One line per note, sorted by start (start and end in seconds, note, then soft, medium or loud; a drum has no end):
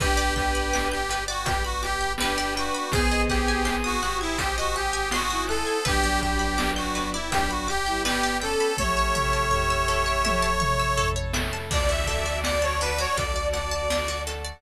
0.00 2.69 G1 medium
0.00 1.45 B3 medium
0.00 0.97 D4 medium
0.00 1.45 D4 medium
0.00 1.45 G4 medium
0.00 0.34 G4 loud
0.00 0.73 B4 loud
0.00 0.97 B4 medium
0.00 0.17 B4 medium
0.00 kick medium
0.00 closed hi-hat medium
0.17 0.34 D5 medium
0.36 0.88 G4 medium
0.36 0.52 G5 medium
0.36 1.83 G5 medium
0.36 kick medium
0.36 closed hi-hat medium
0.55 0.71 B5 medium
0.73 1.46 B4 medium
0.73 0.90 D6 medium
0.73 snare medium
0.92 1.24 G4 medium
0.92 1.08 G6 medium
1.09 1.27 B4 medium
1.09 2.19 D5 medium
1.09 closed hi-hat medium
1.28 1.46 F#4 loud
1.28 1.45 D5 medium
1.45 2.90 G3 medium
1.45 2.90 B3 medium
1.45 2.90 G4 medium
1.45 1.63 G4 medium
1.45 2.55 B4 loud
1.45 1.63 G5 medium
1.45 kick medium
1.45 closed hi-hat loud
1.64 1.82 F#4 medium
1.64 1.81 B5 medium
1.83 2.12 G4 loud
1.83 2.88 G5 medium
1.83 1.99 D6 medium
1.83 closed hi-hat medium
2.01 2.17 G6 medium
2.18 2.84 D4 medium
2.18 2.54 G4 medium
2.18 2.84 B4 medium
2.18 2.37 B4 medium
2.18 2.89 D5 medium
2.18 snare loud
2.38 2.54 D5 medium
2.55 2.91 F#4 medium
2.55 2.91 B4 medium
2.55 2.74 G5 medium
2.55 closed hi-hat medium
2.75 2.91 B5 medium
2.92 5.62 G#1 medium
2.92 3.62 B3 medium
2.92 4.37 C4 medium
2.92 4.37 D#4 medium
2.92 4.37 F#4 medium
2.92 4.37 G#4 medium
2.92 3.22 G#4 loud
2.92 3.62 G#4 loud
2.92 3.10 C5 medium
2.92 3.66 C5 loud
2.92 kick loud
2.92 closed hi-hat medium
3.11 3.28 D#5 medium
3.29 3.75 G4 medium
3.29 3.46 F#5 medium
3.29 4.75 G#5 medium
3.29 kick medium
3.29 closed hi-hat medium
3.48 3.65 G#5 medium
3.65 3.98 B3 medium
3.65 3.98 G#4 medium
3.65 4.39 C5 medium
3.65 3.82 C6 medium
3.65 snare medium
3.84 4.18 F#4 loud
3.84 4.00 D#6 medium
4.02 4.54 G4 medium
4.02 5.12 F#5 medium
4.02 4.19 F#6 medium
4.02 closed hi-hat medium
4.21 4.38 E4 loud
4.21 4.37 G#6 medium
4.38 5.84 C4 medium
4.38 5.84 D#4 medium
4.38 4.56 G4 loud
4.38 5.84 G#4 medium
4.38 4.55 C5 medium
4.38 5.84 C5 medium
4.38 5.48 C5 medium
4.38 kick medium
4.38 closed hi-hat loud
4.57 4.75 F#4 loud
4.57 5.17 G4 medium
4.57 4.74 D#5 medium
4.74 5.09 G4 loud
4.74 4.92 F#5 medium
4.74 5.80 G#5 medium
4.74 closed hi-hat medium
4.93 5.10 G#5 medium
5.11 5.44 F#4 loud
5.11 5.82 F#5 medium
5.11 5.29 C6 medium
5.11 snare loud
5.30 5.77 E4 medium
5.30 5.47 D#6 medium
5.47 5.84 A4 loud
5.47 5.84 C5 medium
5.47 5.65 F#6 medium
5.47 closed hi-hat medium
5.67 5.83 G#6 medium
5.85 8.55 G1 medium
5.85 7.13 F#3 medium
5.85 7.30 B3 medium
5.85 7.30 D4 medium
5.85 7.13 D4 medium
5.85 7.30 G4 medium
5.85 6.20 G4 loud
5.85 6.01 B4 medium
5.85 6.58 B4 loud
5.85 kick medium
5.85 closed hi-hat medium
6.04 6.20 D5 medium
6.21 6.71 G4 medium
6.21 7.68 G5 medium
6.21 6.39 G5 medium
6.21 kick medium
6.21 closed hi-hat medium
6.39 6.56 B5 medium
6.58 7.31 B4 medium
6.58 6.74 D6 medium
6.58 snare loud
6.76 7.09 F#4 medium
6.76 6.93 G6 medium
6.95 7.11 B4 medium
6.95 8.04 D5 medium
6.95 closed hi-hat medium
7.13 7.30 E4 medium
7.13 7.30 D5 medium
7.31 7.66 F#3 medium
7.31 8.77 G3 medium
7.31 8.77 B3 medium
7.31 7.66 D4 medium
7.31 8.77 G4 medium
7.31 7.50 G4 loud
7.31 8.41 B4 loud
7.31 7.49 G5 medium
7.31 kick medium
7.31 closed hi-hat loud
7.50 7.68 F#4 medium
7.50 7.67 B5 medium
7.67 8.02 G4 loud
7.67 8.73 G5 medium
7.67 7.85 D6 medium
7.67 closed hi-hat medium
7.86 8.04 G3 medium
7.86 8.04 E4 medium
7.86 8.03 G6 medium
8.05 8.36 B3 medium
8.05 8.36 G4 medium
8.05 8.37 G4 loud
8.05 8.21 B4 medium
8.05 8.74 D5 medium
8.05 snare loud
8.23 8.40 D5 medium
8.40 8.73 C#4 medium
8.40 8.73 A4 medium
8.40 8.77 A4 loud
8.40 8.76 B4 medium
8.40 8.58 G5 medium
8.40 closed hi-hat medium
8.60 8.77 B5 medium
8.77 11.47 A1 medium
8.77 10.23 A3 medium
8.77 10.23 C#4 medium
8.77 10.23 E4 medium
8.77 9.45 G4 medium
8.77 8.95 A4 medium
8.77 9.51 A4 loud
8.77 11.09 C#5 loud
8.77 9.45 E5 medium
8.77 kick medium
8.77 high tom medium
8.97 9.13 C#5 medium
9.15 10.61 E5 medium
9.15 9.32 E5 medium
9.15 mid tom medium
9.33 9.50 A5 medium
9.50 10.50 G4 medium
9.50 10.24 A4 medium
9.50 10.50 E5 medium
9.50 9.68 C#6 medium
9.50 floor tom medium
9.70 9.87 E6 medium
9.88 10.05 A4 medium
9.88 10.97 C#5 medium
10.06 10.22 C#5 medium
10.24 11.69 A3 medium
10.24 11.69 E4 medium
10.24 11.69 A4 medium
10.24 11.33 A4 loud
10.24 10.41 E5 medium
10.24 high tom medium
10.42 10.59 A5 medium
10.60 11.65 E5 medium
10.60 10.77 C#6 medium
10.60 mid tom medium
10.79 10.96 E6 medium
10.97 11.14 A4 medium
10.97 11.67 C#5 medium
10.97 floor tom medium
11.16 11.32 C#5 medium
11.33 11.69 A4 medium
11.33 11.51 E5 medium
11.33 snare loud
11.53 11.69 A5 medium
11.70 13.05 D2 loud
11.70 14.60 D4 medium
11.70 11.87 D4 medium
11.70 14.60 F#4 medium
11.70 14.12 F#4 medium
11.70 14.60 A4 medium
11.70 14.12 D5 medium
11.70 11.88 D5 loud
11.70 12.43 D5 loud
11.70 kick medium
11.70 crash medium
11.89 12.05 F#4 medium
11.89 12.06 E5 loud
12.06 12.24 A4 medium
12.06 12.38 E5 medium
12.06 13.52 A5 medium
12.06 kick medium
12.06 closed hi-hat medium
12.26 12.42 D5 medium
12.43 13.16 D5 medium
12.43 12.62 D5 loud
12.43 12.61 F#5 medium
12.43 snare loud
12.62 12.79 C#5 medium
12.62 12.79 A5 medium
12.81 12.97 D4 medium
12.81 12.98 B4 loud
12.81 13.90 F#5 medium
12.81 closed hi-hat medium
12.98 13.15 F#4 medium
12.98 13.17 C#5 loud
13.17 14.52 D2 medium
13.17 13.34 A4 medium
13.17 14.27 D5 medium
13.17 13.47 D5 medium
13.17 kick medium
13.17 closed hi-hat medium
13.36 13.52 D5 medium
13.53 14.22 D5 medium
13.53 13.70 F#5 medium
13.53 14.57 A5 medium
13.53 snare soft
13.53 closed hi-hat medium
13.71 13.88 A5 medium
13.90 14.07 D4 medium
13.90 14.60 F#5 medium
13.90 snare medium
14.08 14.25 F#4 medium
14.27 14.43 A4 medium
14.27 14.62 D5 medium
14.27 closed hi-hat medium
14.45 14.61 D5 medium